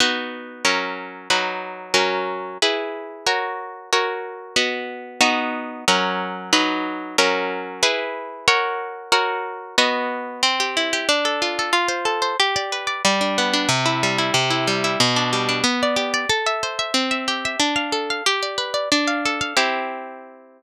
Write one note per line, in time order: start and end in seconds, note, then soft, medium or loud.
0.00 0.64 B3 medium
0.00 0.64 D#4 medium
0.00 0.64 F#4 medium
0.65 1.29 F#3 medium
0.65 1.29 C#4 medium
0.65 1.29 A#4 medium
1.30 1.93 F#3 medium
1.30 1.94 D#4 medium
1.30 1.94 B4 medium
1.94 2.58 F#3 medium
1.94 2.58 C#4 medium
1.94 2.58 A#4 medium
2.62 3.26 E4 medium
2.62 3.26 G#4 medium
2.62 3.26 B4 medium
3.26 3.90 F#4 medium
3.26 3.90 A#4 medium
3.26 3.90 C#5 medium
3.93 4.56 F#4 medium
3.93 4.57 A#4 medium
3.93 4.57 C#5 medium
4.56 5.20 B3 medium
4.56 5.20 F#4 medium
4.56 5.20 D#5 medium
5.21 5.85 B3 loud
5.21 5.85 D#4 loud
5.21 5.85 F#4 loud
5.88 6.52 F#3 loud
5.88 6.52 C#4 loud
5.88 6.52 A#4 loud
6.53 7.17 F#3 loud
6.53 7.17 D#4 loud
6.53 7.17 B4 loud
7.18 7.82 F#3 loud
7.18 7.82 C#4 loud
7.18 7.82 A#4 loud
7.83 8.47 E4 loud
7.83 8.47 G#4 loud
7.83 8.47 B4 loud
8.48 9.11 F#4 loud
8.48 9.11 A#4 loud
8.48 9.11 C#5 loud
9.12 9.76 F#4 loud
9.12 9.76 A#4 loud
9.12 9.76 C#5 loud
9.78 10.42 B3 loud
9.78 10.42 F#4 loud
9.78 10.42 D#5 medium
10.43 11.05 C4 loud
10.60 10.92 G4 medium
10.77 11.08 E4 medium
10.93 11.08 G4 loud
11.09 11.71 D4 loud
11.25 11.58 A4 medium
11.42 11.72 F4 medium
11.59 11.74 A4 medium
11.73 12.35 F4 loud
11.88 12.21 C5 medium
12.05 12.36 A4 medium
12.22 12.37 C5 medium
12.40 13.02 G4 loud
12.56 12.87 D5 loud
12.72 13.03 B4 medium
12.87 13.03 D5 medium
13.05 13.67 G3 loud
13.21 13.53 D4 medium
13.38 13.69 B3 medium
13.53 13.69 D4 medium
13.69 14.31 C3 loud
13.86 14.18 E4 medium
14.03 14.34 G3 medium
14.18 14.34 E4 medium
14.34 14.96 C3 loud
14.50 14.83 E4 medium
14.67 14.98 G3 medium
14.84 15.00 E4 medium
15.00 15.62 B2 loud
15.16 15.48 D4 medium
15.33 15.64 G3 medium
15.49 15.64 D4 medium
15.64 16.26 B3 loud
15.83 16.13 D5 medium
15.96 16.27 G4 medium
16.14 16.29 D5 medium
16.29 16.91 A4 loud
16.46 16.78 E5 medium
16.63 16.94 C5 medium
16.79 16.94 E5 medium
16.94 17.56 C4 loud
17.11 17.45 E5 medium
17.28 17.59 G4 medium
17.45 17.61 E5 medium
17.60 18.21 D4 loud
17.76 18.10 F5 medium
17.92 18.23 A4 medium
18.10 18.26 F5 medium
18.26 18.88 G4 loud
18.43 18.73 D5 medium
18.58 18.89 B4 medium
18.74 18.89 D5 medium
18.92 19.54 D4 loud
19.07 19.40 F5 medium
19.25 19.56 A4 medium
19.41 19.56 F5 medium
19.57 20.62 C4 medium
19.57 20.62 E4 medium
19.57 20.62 G4 medium